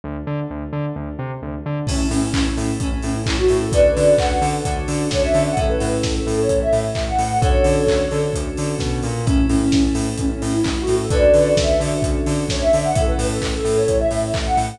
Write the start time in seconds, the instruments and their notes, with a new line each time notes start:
0.04 synth bass 2 D2
0.27 synth bass 2 D3
0.50 synth bass 2 D2
0.73 synth bass 2 D3
0.96 synth bass 2 D2
1.19 synth bass 2 C3
1.42 synth bass 2 D2
1.66 synth bass 2 D3
1.87 synth bass 2 A1, electric piano 2 C#4 E4 A4, ocarina C#4, kick, crash
2.11 synth bass 2 A2, ocarina C#4, open hi-hat
2.23 ocarina C#4
2.34 synth bass 2 A1, electric piano 2 C#4 E4 A4, kick, clap
2.57 synth bass 2 A2, open hi-hat
2.80 synth bass 2 A1, ocarina C#4, electric piano 2 C#4 E4 A4, kick, closed hi-hat
2.92 ocarina C#4
3.02 synth bass 2 A2, ocarina C#4, open hi-hat
3.15 ocarina E4
3.26 synth bass 2 A1, electric piano 2 C#4 E4 A4, kick, clap
3.39 ocarina F#4
3.48 synth bass 2 A2, open hi-hat
3.61 ocarina A4
3.72 synth bass 2 D2, electric piano 2 C#4 D4 F#4 A4, ocarina B4 D5, kick, closed hi-hat
3.97 synth bass 2 D3, open hi-hat
4.18 synth bass 2 D2, electric piano 2 C#4 D4 F#4 A4, ocarina F#5, kick, clap
4.42 synth bass 2 D3, open hi-hat
4.65 synth bass 2 D2, electric piano 2 C#4 D4 F#4 A4, kick, closed hi-hat
4.88 synth bass 2 D3, open hi-hat
5.11 synth bass 2 D2, electric piano 2 C#4 D4 F#4 A4, ocarina C#5, kick, snare
5.22 ocarina E5
5.34 synth bass 2 D3, open hi-hat
5.46 ocarina F#5
5.56 synth bass 2 A1, electric piano 2 C#4 E4 A4, ocarina A4, kick, closed hi-hat
5.69 ocarina B4
5.80 synth bass 2 A2, open hi-hat
5.92 ocarina A4
6.03 synth bass 2 A1, kick, snare
6.15 ocarina A4
6.27 synth bass 2 A2, open hi-hat
6.38 ocarina C#5
6.49 synth bass 2 A1, kick, closed hi-hat
6.62 ocarina E5
6.73 synth bass 2 A2, open hi-hat
6.95 synth bass 2 A1, kick, clap
7.07 ocarina F#5
7.19 synth bass 2 A2, open hi-hat
7.30 ocarina F#5
7.42 synth bass 2 D2, electric piano 2 C#4 D4 F#4 A4, ocarina A4 C#5, kick, closed hi-hat
7.64 synth bass 2 D3, open hi-hat
7.87 synth bass 2 D2, kick, clap
8.11 synth bass 2 D3, open hi-hat
8.33 synth bass 2 D2, kick, closed hi-hat
8.57 synth bass 2 D3, open hi-hat
8.79 synth bass 2 B2, kick, snare
9.03 synth bass 2 A#2, open hi-hat
9.26 synth bass 2 A1, electric piano 2 C#4 E4 A4, ocarina C#4, kick, closed hi-hat
9.49 synth bass 2 A2, ocarina C#4, open hi-hat
9.61 ocarina C#4
9.72 synth bass 2 A1, kick, snare
9.95 synth bass 2 A2, open hi-hat
10.17 synth bass 2 A1, ocarina C#4, kick, closed hi-hat
10.31 ocarina C#4
10.42 synth bass 2 A2, ocarina C#4, open hi-hat
10.53 ocarina E4
10.64 synth bass 2 A1, kick, clap
10.77 ocarina F#4
10.87 synth bass 2 A2, open hi-hat
11.00 ocarina A4
11.10 synth bass 2 D2, electric piano 2 C#4 D4 F#4 A4, ocarina B4 D5, kick, closed hi-hat
11.34 synth bass 2 D3, open hi-hat
11.57 synth bass 2 D2, ocarina E5, kick, snare
11.80 synth bass 2 D3, open hi-hat
12.02 synth bass 2 D2, kick, closed hi-hat
12.26 synth bass 2 D3, open hi-hat
12.49 synth bass 2 D2, ocarina C#5, kick, snare
12.61 ocarina E5
12.73 synth bass 2 D3, open hi-hat
12.85 ocarina F#5
12.95 synth bass 2 A1, electric piano 2 C#4 E4 A4, ocarina A4, kick, closed hi-hat
13.07 ocarina B4
13.18 synth bass 2 A2, open hi-hat
13.30 ocarina A4
13.41 synth bass 2 A1, kick, clap
13.53 ocarina A4
13.65 synth bass 2 A2, open hi-hat
13.77 ocarina C#5
13.88 synth bass 2 A1, kick, closed hi-hat
14.00 ocarina E5
14.11 synth bass 2 A2, open hi-hat
14.34 synth bass 2 A1, kick, clap
14.46 ocarina F#5
14.57 synth bass 2 A2, open hi-hat
14.69 ocarina F#5